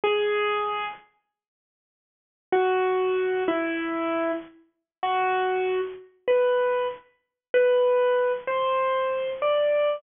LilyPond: \new Staff { \time 4/4 \key b \minor \tempo 4 = 96 gis'4. r2 r8 | fis'4. e'4. r4 | fis'4. r8 b'4 r4 | \key e \minor b'4. c''4. d''4 | }